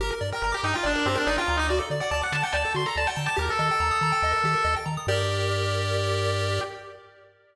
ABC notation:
X:1
M:4/4
L:1/16
Q:1/4=142
K:Gm
V:1 name="Lead 1 (square)"
B z2 B B G E F D2 C D E F2 E | d z2 d d ^f a g a2 c' b a g2 a | B A13 z2 | G16 |]
V:2 name="Lead 1 (square)"
G B d g b d' b g d B G B d g b d' | ^F A d ^f a d' a f d A F A d f a d' | G B e g b e' b g e B G B e g b e' | [GBd]16 |]
V:3 name="Synth Bass 1" clef=bass
G,,,2 G,,2 G,,,2 G,,2 G,,,2 G,,2 G,,,2 D,,2- | D,,2 D,2 D,,2 D,2 D,,2 D,2 D,,2 D,2 | E,,2 E,2 E,,2 E,2 E,,2 E,2 E,,2 E,2 | G,,16 |]